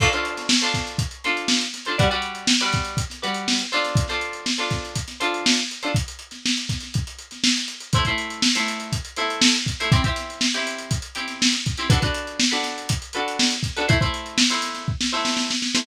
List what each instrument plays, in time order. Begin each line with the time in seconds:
0.00 pizzicato strings D4 F4 A4 C5, kick, crash
0.12 pizzicato strings D4 F4 A4 C5, closed hi-hat
0.25 closed hi-hat
0.37 snare, closed hi-hat
0.49 snare
0.61 pizzicato strings D4 F4 A4 C5, closed hi-hat
0.74 kick, snare, closed hi-hat
0.87 closed hi-hat
0.98 kick, closed hi-hat
1.11 closed hi-hat
1.24 pizzicato strings D4 F4 A4 C5, snare, closed hi-hat
1.37 closed hi-hat
1.48 snare
1.61 closed hi-hat
1.74 snare, closed hi-hat
1.85 pizzicato strings D4 F4 A4 C5, closed hi-hat
1.98 pizzicato strings G3 F#4 B4 D5, kick, closed hi-hat
2.10 pizzicato strings G3 F#4 B4 D5, closed hi-hat
2.22 closed hi-hat
2.35 closed hi-hat
2.47 snare
2.61 pizzicato strings G3 F#4 B4 D5, closed hi-hat
2.73 kick, snare, closed hi-hat
2.85 closed hi-hat
2.97 kick, closed hi-hat
3.10 snare, closed hi-hat
3.22 pizzicato strings G3 F#4 B4 D5, closed hi-hat
3.34 closed hi-hat
3.48 snare
3.59 closed hi-hat
3.72 pizzicato strings D4 F4 A4 C5, snare, closed hi-hat
3.84 snare, closed hi-hat
3.95 kick, closed hi-hat
4.08 pizzicato strings D4 F4 A4 C5, snare, closed hi-hat
4.21 closed hi-hat
4.33 closed hi-hat
4.46 snare
4.58 pizzicato strings D4 F4 A4 C5, closed hi-hat
4.70 kick, snare, closed hi-hat
4.85 closed hi-hat
4.95 kick, closed hi-hat
5.08 snare, closed hi-hat
5.20 pizzicato strings D4 F4 A4 C5, closed hi-hat
5.34 closed hi-hat
5.46 snare
5.57 closed hi-hat
5.71 closed hi-hat
5.83 pizzicato strings D4 F4 A4 C5, closed hi-hat
5.95 kick, closed hi-hat
6.08 closed hi-hat
6.19 closed hi-hat
6.31 snare, closed hi-hat
6.46 snare
6.57 closed hi-hat
6.69 kick, snare, closed hi-hat
6.80 snare, closed hi-hat
6.94 kick, closed hi-hat
7.07 closed hi-hat
7.18 closed hi-hat
7.31 snare, closed hi-hat
7.44 snare
7.57 closed hi-hat
7.68 closed hi-hat
7.80 closed hi-hat
7.93 pizzicato strings A3 E4 C5, kick, closed hi-hat
8.05 pizzicato strings A3 E4 C5, kick, closed hi-hat
8.18 closed hi-hat
8.30 closed hi-hat
8.42 snare
8.55 pizzicato strings A3 E4 C5, snare, closed hi-hat
8.68 closed hi-hat
8.80 closed hi-hat
8.92 kick, closed hi-hat
9.05 closed hi-hat
9.16 pizzicato strings A3 E4 C5, snare, closed hi-hat
9.30 closed hi-hat
9.42 snare
9.55 closed hi-hat
9.66 kick, closed hi-hat
9.80 pizzicato strings A3 E4 C5, closed hi-hat
9.92 pizzicato strings C4 E4 G4, kick, closed hi-hat
10.04 pizzicato strings C4 E4 G4, kick, closed hi-hat
10.16 snare, closed hi-hat
10.30 closed hi-hat
10.41 snare
10.54 pizzicato strings C4 E4 G4, closed hi-hat
10.67 closed hi-hat
10.78 closed hi-hat
10.91 kick, closed hi-hat
11.02 closed hi-hat
11.15 pizzicato strings C4 E4 G4, closed hi-hat
11.28 snare, closed hi-hat
11.42 snare
11.53 snare, closed hi-hat
11.66 kick, closed hi-hat
11.77 pizzicato strings C4 E4 G4, closed hi-hat
11.90 pizzicato strings D4 F#4 A4 B4, kick, closed hi-hat
12.02 pizzicato strings D4 F#4 A4 B4, kick, closed hi-hat
12.14 closed hi-hat
12.27 closed hi-hat
12.40 snare
12.51 pizzicato strings D4 F#4 A4 B4, closed hi-hat
12.63 snare, closed hi-hat
12.78 closed hi-hat
12.89 kick, closed hi-hat
13.02 closed hi-hat
13.13 pizzicato strings D4 F#4 A4 B4, closed hi-hat
13.28 closed hi-hat
13.39 snare
13.51 closed hi-hat
13.63 kick, closed hi-hat
13.76 pizzicato strings D4 F#4 A4 B4, closed hi-hat
13.88 pizzicato strings A3 E4 C5, kick, closed hi-hat
14.01 pizzicato strings A3 E4 C5, kick, closed hi-hat
14.14 closed hi-hat
14.26 closed hi-hat
14.38 snare
14.50 pizzicato strings A3 E4 C5, closed hi-hat
14.62 snare, closed hi-hat
14.74 snare, closed hi-hat
14.88 kick
15.01 snare
15.12 pizzicato strings A3 E4 C5
15.25 snare
15.37 snare
15.51 snare
15.62 snare
15.75 pizzicato strings A3 E4 C5, snare